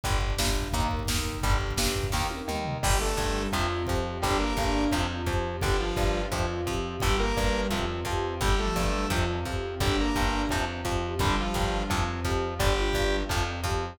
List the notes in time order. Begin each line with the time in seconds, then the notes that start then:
0.03 G1 D3 G3 D4 G4, kick, closed hi-hat
0.12 kick
0.21 kick
0.30 kick
0.38 G1 G2, kick, snare
0.49 kick
0.55 kick
0.64 kick
0.73 D#2 D#3 A#3 D#4 A#4, kick, closed hi-hat
0.83 kick
0.91 kick
0.99 kick
1.07 D#2 D#3, kick, snare
1.18 kick
1.26 kick
1.35 kick
1.43 G1 D3 G3 D4 G4, kick, closed hi-hat
1.53 kick
1.61 kick
1.71 kick
1.77 G1 G2, kick, snare
1.88 kick
1.96 kick
2.04 kick
2.12 D#2 D#3 A#3 D#4 A#4, kick, snare
2.30 high tom
2.48 D#2 D#3, mid tom
2.65 floor tom
2.83 G1 D3 G3 D4 G4, kick, crash
3.00 A3 A4
3.17 G1 G2 G3, kick
3.35 G3
3.52 F2 C3 F3 C4 F4, kick
3.87 F2 F3 G4, kick
4.22 G1 D3 G3 D4 G4, kick
4.39 A#3 A#4
4.57 G1 G2, kick
4.92 F2 C3 F3 C4 F4, kick
5.26 F2 F3 G4, kick
5.61 G1 D3 G3 D4 G4, kick
5.79 F3 F4
5.96 G1 G2 G3, kick
6.16 G3
6.32 F2 C3 F3 C4 F4, kick
6.67 F2 F3 G4, kick
7.00 G1 D3 G3 D4 G4, kick
7.19 A#3 A#4
7.37 G1 G2, kick
7.70 F2 C3 F3 C4 F4, kick
8.05 F2 F3 G4, kick
8.40 G1 D3 G3 D4 G4, kick
8.59 A3 A4
8.65 F3
8.76 G1 G2, kick
8.87 G3
9.10 F2 C3 F3 C4 F4, kick
9.45 F2 F3 G4, kick
9.79 G1 D3 G3 D4 G4, kick
10.00 A#3 A#4
10.15 G1 G2, kick
10.49 F2 C3 F3 C4 F4, kick
10.85 F2 F3 G4, kick
11.19 G1 D3 G3 D4 G4, kick
11.40 F3 F4
11.54 G1 G2, kick
11.89 F2 C3 F3 C4 F4, kick
12.25 F2 F3 G4, kick
12.59 G1 D3 G3 D4 G4, kick
12.78 F4
12.93 G1 G2, kick
13.29 F2 C3 F3 C4 F4, kick
13.64 F2 F3 G4, kick